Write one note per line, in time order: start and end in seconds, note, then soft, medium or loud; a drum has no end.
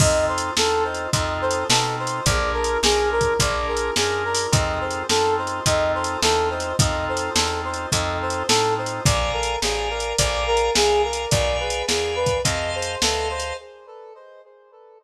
0.00 0.51 F2 medium
0.00 0.51 C4 medium
0.00 0.51 D#4 medium
0.00 0.51 F4 medium
0.00 0.51 A4 medium
0.00 0.25 D#5 loud
0.00 kick loud
0.00 crash medium
0.28 0.54 C5 medium
0.38 closed hi-hat medium
0.57 1.08 E2 medium
0.57 1.08 C4 medium
0.57 1.08 D#4 medium
0.57 1.08 F4 medium
0.57 1.08 A4 medium
0.57 0.83 A4 medium
0.57 snare loud
0.84 1.10 C5 medium
0.94 closed hi-hat medium
1.13 1.64 F2 medium
1.13 1.64 C4 medium
1.13 1.64 D#4 medium
1.13 1.64 F4 medium
1.13 1.64 A4 medium
1.13 1.39 D#5 loud
1.13 kick medium
1.13 closed hi-hat medium
1.41 1.67 C5 medium
1.51 closed hi-hat medium
1.69 2.21 B2 medium
1.69 2.21 C4 medium
1.69 2.21 D#4 medium
1.69 2.21 F4 medium
1.69 1.96 A4 loud
1.69 2.21 A4 medium
1.69 snare loud
1.99 2.25 C5 medium
2.07 closed hi-hat medium
2.26 2.77 A#1 medium
2.26 2.78 D4 medium
2.26 2.78 F4 medium
2.26 2.78 G#4 medium
2.26 2.78 A#4 medium
2.26 2.52 D5 loud
2.26 kick medium
2.26 closed hi-hat medium
2.53 2.79 A#4 medium
2.64 closed hi-hat medium
2.83 3.34 B1 medium
2.83 3.34 D4 medium
2.83 3.34 F4 medium
2.83 3.34 G#4 medium
2.83 3.09 G#4 medium
2.83 3.34 A#4 medium
2.83 snare loud
3.12 3.38 A#4 medium
3.21 kick medium
3.21 closed hi-hat medium
3.40 3.91 A#1 medium
3.40 3.91 D4 medium
3.40 3.91 F4 medium
3.40 3.91 G#4 medium
3.40 3.91 A#4 medium
3.40 3.67 D5 loud
3.40 kick medium
3.40 closed hi-hat medium
3.68 3.94 A#4 medium
3.77 closed hi-hat medium
3.96 4.47 F#2 medium
3.96 4.47 D4 medium
3.96 4.47 F4 medium
3.96 4.47 G#4 medium
3.96 4.23 G#4 loud
3.96 4.47 A#4 medium
3.96 snare loud
4.25 4.51 A#4 medium
4.35 open hi-hat medium
4.52 5.04 F2 medium
4.52 5.03 C4 medium
4.52 5.03 D#4 medium
4.52 5.03 F4 medium
4.52 5.03 A4 medium
4.52 4.79 D#5 loud
4.52 kick loud
4.52 closed hi-hat medium
4.81 5.07 C5 medium
4.91 closed hi-hat medium
5.09 5.60 F#2 medium
5.09 5.60 C4 medium
5.09 5.60 D#4 medium
5.09 5.60 F4 medium
5.09 5.60 A4 medium
5.09 5.35 A4 loud
5.09 snare loud
5.38 5.64 C5 medium
5.47 closed hi-hat medium
5.66 6.17 F2 medium
5.66 6.18 C4 medium
5.66 6.18 D#4 medium
5.66 6.18 F4 medium
5.66 6.18 A4 medium
5.66 5.92 D#5 medium
5.66 kick medium
5.66 closed hi-hat medium
5.95 6.21 C5 medium
6.04 closed hi-hat medium
6.22 6.73 E2 medium
6.22 6.73 C4 medium
6.22 6.73 D#4 medium
6.22 6.73 F4 medium
6.22 6.73 A4 medium
6.22 6.49 A4 medium
6.22 snare loud
6.50 6.76 C5 medium
6.60 closed hi-hat medium
6.79 7.30 F2 medium
6.79 7.31 C4 medium
6.79 7.31 D#4 medium
6.79 7.31 F4 medium
6.79 7.31 A4 medium
6.79 7.05 D#5 loud
6.79 kick loud
6.79 closed hi-hat loud
7.09 7.35 C5 medium
7.17 closed hi-hat medium
7.35 7.86 E2 medium
7.35 7.87 C4 medium
7.35 7.87 D#4 medium
7.35 7.87 F4 medium
7.35 7.60 A4 loud
7.35 7.87 A4 medium
7.35 snare loud
7.65 7.91 C5 medium
7.74 closed hi-hat medium
7.92 8.43 F2 medium
7.92 8.43 C4 medium
7.92 8.43 D#4 medium
7.92 8.43 F4 medium
7.92 8.43 A4 medium
7.92 8.18 D#5 medium
7.92 kick medium
7.92 closed hi-hat medium
8.22 8.48 C5 medium
8.30 closed hi-hat medium
8.48 9.00 A2 medium
8.48 9.01 C4 medium
8.48 9.01 D#4 medium
8.48 9.01 F4 medium
8.48 8.74 A4 medium
8.48 9.01 A4 medium
8.48 snare loud
8.78 9.04 C5 medium
8.86 closed hi-hat medium
9.05 9.57 A#1 medium
9.05 9.56 D5 medium
9.05 9.31 D5 loud
9.05 9.56 F5 medium
9.05 9.56 G#5 medium
9.05 9.56 A#5 medium
9.05 kick loud
9.05 closed hi-hat medium
9.33 9.59 A#4 medium
9.43 closed hi-hat medium
9.62 10.13 A1 medium
9.62 9.88 G#4 medium
9.62 10.13 D5 medium
9.62 10.13 F5 medium
9.62 10.13 G#5 medium
9.62 10.13 A#5 medium
9.62 snare medium
9.90 10.16 A#4 medium
10.00 closed hi-hat medium
10.18 10.70 A#1 medium
10.18 10.44 D5 loud
10.18 10.71 D5 medium
10.18 10.71 F5 medium
10.18 10.71 G#5 medium
10.18 10.71 A#5 medium
10.18 kick medium
10.18 closed hi-hat loud
10.47 10.73 A#4 medium
10.57 closed hi-hat medium
10.74 11.26 C2 medium
10.74 11.02 G#4 loud
10.74 11.25 D5 medium
10.74 11.25 F5 medium
10.74 11.25 G#5 medium
10.74 11.25 A#5 medium
10.74 snare loud
11.04 11.30 A#4 medium
11.13 closed hi-hat medium
11.31 11.83 B1 medium
11.31 11.57 D5 loud
11.31 11.83 D5 medium
11.31 11.83 F5 medium
11.31 11.83 G#5 medium
11.31 11.83 B5 medium
11.31 kick medium
11.31 closed hi-hat medium
11.60 11.86 B4 medium
11.70 closed hi-hat medium
11.88 12.40 E2 medium
11.88 12.15 G#4 medium
11.88 12.39 D5 medium
11.88 12.39 F5 medium
11.88 12.39 G#5 medium
11.88 12.39 B5 medium
11.88 snare medium
12.16 12.42 B4 medium
12.26 kick medium
12.26 closed hi-hat medium
12.44 12.96 F2 medium
12.44 12.70 D#5 medium
12.44 12.96 D#5 medium
12.44 12.96 F5 medium
12.44 12.96 A5 medium
12.44 12.96 C6 medium
12.44 kick medium
12.44 closed hi-hat medium
12.75 13.01 C5 loud
12.82 closed hi-hat medium
13.02 13.53 D2 medium
13.02 13.28 A4 loud
13.02 13.53 D#5 medium
13.02 13.53 F5 medium
13.02 13.53 A5 medium
13.02 13.53 C6 medium
13.02 snare loud
13.30 13.56 C5 medium
13.40 closed hi-hat medium